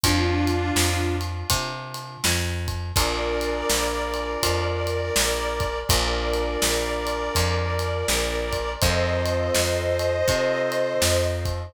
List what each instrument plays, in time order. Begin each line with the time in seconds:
0.04 electric bass (finger) F2, harmonica D4 F4, kick, ride
0.47 ride
0.76 electric bass (finger) F2, snare
1.21 ride
1.50 electric bass (finger) C3, kick, ride
1.94 ride
2.24 electric bass (finger) F2, snare
2.68 kick, ride
2.95 electric bass (finger) A#1, acoustic grand piano D4 F4 G#4 A#4, harmonica A#4 D5, kick, ride
3.41 ride
3.70 electric bass (finger) A#1, snare
4.14 ride
4.43 electric bass (finger) F2, kick, ride
4.87 ride
5.16 electric bass (finger) A#1, snare
5.60 kick, ride
5.89 electric bass (finger) A#1, acoustic grand piano D4 F4 G#4 A#4, harmonica A#4 D5, kick, ride
6.33 ride
6.62 electric bass (finger) A#1, snare
7.07 ride
7.35 electric bass (finger) F2, kick, ride
7.79 ride
8.08 electric bass (finger) A#1, snare
8.52 kick, ride
8.81 electric bass (finger) F2, acoustic grand piano C4 D#4 F4 A4, harmonica C5 D#5, kick, ride
9.25 ride
9.54 electric bass (finger) F2, snare
9.99 ride
10.27 electric bass (finger) C3, acoustic grand piano C4 D#4 F4 A4, kick, ride
10.72 ride
11.02 electric bass (finger) F2, snare
11.45 kick, ride